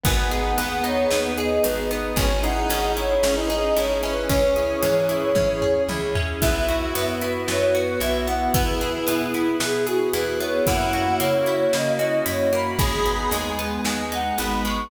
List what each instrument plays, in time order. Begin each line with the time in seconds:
0.03 electric bass (finger) G#1, electric piano 1 B3, lead 1 (square) B3, pad 2 (warm) B3 D#4 G#4, acoustic guitar (steel) B3, ocarina G#5, kick, closed hi-hat
0.30 electric piano 1 D#4, acoustic guitar (steel) G#4, ocarina F#5, closed hi-hat
0.58 electric bass (finger) D#2, acoustic guitar (steel) B3, lead 1 (square) B3, electric piano 1 G#4, closed hi-hat
0.84 electric piano 1 B3, acoustic guitar (steel) D#4, ocarina C#5, closed hi-hat
1.11 electric bass (finger) D#2, acoustic guitar (steel) B3, electric piano 1 D#4, snare
1.24 ocarina B4
1.37 electric piano 1 G#4, acoustic guitar (steel) G#4, ocarina D#5, closed hi-hat
1.63 electric bass (finger) G#1, electric piano 1 B3, acoustic guitar (steel) D#4, ocarina B4, closed hi-hat
1.91 acoustic guitar (steel) B3, electric piano 1 D#4, ocarina B4, closed hi-hat
2.16 electric bass (finger) G#1, lead 1 (square) C#4, acoustic guitar (steel) C#4, pad 2 (warm) C#4 E4 G#4, electric piano 1 C#4, ocarina G#5, kick, closed hi-hat
2.43 lead 1 (square) D#4, electric piano 1 E4, acoustic guitar (steel) G#4, ocarina F#5, closed hi-hat
2.69 electric bass (finger) G#1, acoustic guitar (steel) C#4, electric piano 1 G#4, closed hi-hat
2.96 electric piano 1 C#4, acoustic guitar (steel) E4, ocarina C#5, closed hi-hat
3.23 electric bass (finger) G#1, acoustic guitar (steel) C#4, lead 1 (square) C#4, electric piano 1 E4, snare
3.36 lead 1 (square) D#4, ocarina B4
3.50 electric piano 1 G#4, acoustic guitar (steel) G#4, ocarina D#5, closed hi-hat
3.76 electric bass (finger) G#1, electric piano 1 C#4, acoustic guitar (steel) E4, ocarina C#5, closed hi-hat
4.03 lead 1 (square) C#4, acoustic guitar (steel) C#4, electric piano 1 E4, ocarina B4, closed hi-hat
4.29 electric bass (finger) C#2, electric piano 1 C#4, acoustic guitar (steel) C#4, lead 1 (square) C#4, pad 2 (warm) C#4 E4 G#4, ocarina C#5, kick, closed hi-hat
4.56 electric piano 1 E4, acoustic guitar (steel) G#4, closed hi-hat
4.81 electric bass (finger) G#2, lead 1 (square) E3, acoustic guitar (steel) C#4, electric piano 1 G#4, closed hi-hat
5.09 electric piano 1 C#4, acoustic guitar (steel) E4, closed hi-hat
5.35 electric bass (finger) G#2, acoustic guitar (steel) C#4, electric piano 1 E4, kick, high tom
5.61 electric piano 1 G#4, acoustic guitar (steel) G#4, floor tom
5.88 electric bass (finger) C#2, electric piano 1 C#4, acoustic guitar (steel) E4, high tom
6.15 acoustic guitar (steel) C#4, electric piano 1 E4, floor tom
6.41 electric bass (finger) B1, pad 2 (warm) B3 E4 F#4, electric piano 1 B3, acoustic guitar (steel) B3, lead 1 (square) E4, ocarina E5, kick, closed hi-hat
6.67 electric piano 1 E4, acoustic guitar (steel) F#4, closed hi-hat
6.94 electric bass (finger) F#2, acoustic guitar (steel) B3, electric piano 1 F#4, ocarina B4, closed hi-hat
7.21 electric piano 1 B3, acoustic guitar (steel) E4, closed hi-hat
7.47 electric bass (finger) F#2, acoustic guitar (steel) B3, electric piano 1 E4, ocarina C#5, snare
7.61 ocarina C#5
7.75 acoustic guitar (steel) F#4, electric piano 1 F#4, ocarina B4, closed hi-hat
8.00 electric bass (finger) B1, electric piano 1 B3, acoustic guitar (steel) E4, ocarina E5, closed hi-hat
8.27 acoustic guitar (steel) B3, electric piano 1 E4, ocarina F#5, closed hi-hat
8.54 electric bass (finger) E2, electric piano 1 B3, pad 2 (warm) B3 E4 G#4, acoustic guitar (steel) B3, lead 1 (square) E4, ocarina B4, kick, closed hi-hat
8.81 electric piano 1 E4, acoustic guitar (steel) G#4, closed hi-hat
9.07 electric bass (finger) B2, acoustic guitar (steel) B3, ocarina E4, electric piano 1 G#4, closed hi-hat
9.34 electric piano 1 B3, acoustic guitar (steel) E4, closed hi-hat
9.60 electric bass (finger) B2, acoustic guitar (steel) B3, electric piano 1 E4, ocarina G#4, snare
9.74 ocarina G#4
9.87 ocarina F#4, acoustic guitar (steel) G#4, electric piano 1 G#4, closed hi-hat
10.13 electric bass (finger) E2, electric piano 1 B3, acoustic guitar (steel) E4, ocarina B4, closed hi-hat
10.40 acoustic guitar (steel) B3, electric piano 1 E4, ocarina C#5, closed hi-hat
10.65 electric bass (finger) F#2, pad 2 (warm) A#3 C#4 E4 F#4, electric piano 1 A#3, acoustic guitar (steel) A#3, lead 1 (square) E4, ocarina F#5, kick, closed hi-hat
10.93 electric piano 1 C#4, acoustic guitar (steel) F#4, closed hi-hat
11.20 electric bass (finger) C#3, acoustic guitar (steel) A#3, electric piano 1 E4, ocarina C#5, closed hi-hat
11.46 acoustic guitar (steel) E4, electric piano 1 F#4, closed hi-hat
11.73 electric bass (finger) C#3, acoustic guitar (steel) A#3, electric piano 1 A#3, ocarina D#5, snare
11.86 ocarina D#5
11.99 electric piano 1 C#4, acoustic guitar (steel) F#4, ocarina D#5, closed hi-hat
12.26 electric bass (finger) F#2, electric piano 1 E4, acoustic guitar (steel) E4, ocarina C#5, closed hi-hat
12.52 acoustic guitar (steel) A#3, electric piano 1 F#4, ocarina B5, closed hi-hat
12.79 electric bass (finger) G#1, electric piano 1 G#3, acoustic guitar (steel) G#3, pad 2 (warm) G#3 B3 D#4, lead 1 (square) G#4, ocarina B5, kick, closed hi-hat
13.05 electric piano 1 B3, acoustic guitar (steel) D#4, closed hi-hat
13.31 electric bass (finger) D#2, acoustic guitar (steel) G#3, electric piano 1 D#4, ocarina G#5, closed hi-hat
13.58 electric piano 1 G#3, acoustic guitar (steel) B3, closed hi-hat
13.84 electric bass (finger) D#2, acoustic guitar (steel) G#3, electric piano 1 B3, ocarina G#5, snare
13.99 ocarina G#5
14.12 acoustic guitar (steel) D#4, electric piano 1 D#4, ocarina F#5, closed hi-hat
14.38 electric bass (finger) G#1, electric piano 1 G#3, acoustic guitar (steel) B3, ocarina B5, closed hi-hat
14.64 acoustic guitar (steel) G#3, electric piano 1 B3, ocarina C#6, closed hi-hat